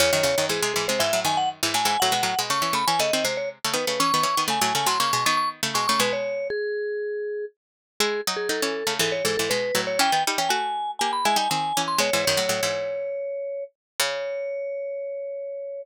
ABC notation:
X:1
M:4/4
L:1/16
Q:1/4=120
K:C#m
V:1 name="Vibraphone"
c4 G2 G ^B e2 g f z2 g g | f4 c'2 b g d2 ^B c z2 =B B | c'4 g2 g ^b c'2 c' c' z2 c' c' | B c3 G8 z4 |
G2 z G A4 A c A A B3 c | =g2 z g ^g4 g b g g g3 ^b | c2 c12 z2 | c16 |]
V:2 name="Pizzicato Strings"
[E,,C,] [F,,D,] [E,,C,] [F,,D,] [G,,E,] [^B,,G,] [G,,E,] [B,,G,] [G,,E,] [A,,F,] [F,,D,]3 [G,,E,] [A,,F,] [G,,E,] | [A,,F,] [B,,G,] [A,,F,] [B,,G,] [C,A,] [E,C] [C,A,] [E,C] [C,A,] [D,^B,] [^B,,G,]3 [C,A,] [D,=B,] [C,A,] | [E,C] [D,B,] [E,C] [D,B,] [C,A,] [A,,F,] [C,A,] [A,,F,] [C,^A,] [B,,G,] [D,B,]3 [C,=A,] [B,,G,] [C,A,] | [B,,G,]14 z2 |
[G,E]2 [F,D]2 [F,D] [E,C]2 [C,A,] [G,,E,]2 [G,,E,] [G,,E,] [B,,G,]2 [A,,F,]2 | [E,C] [D,B,] [=G,D] [E,C] [A,F]4 [^A,=G]2 [^G,E] [=G,D] [D,^B,]2 [E,C]2 | [B,,G,] [G,,E,] [F,,D,] [A,,F,] [A,,F,] [G,,E,]9 z2 | C,16 |]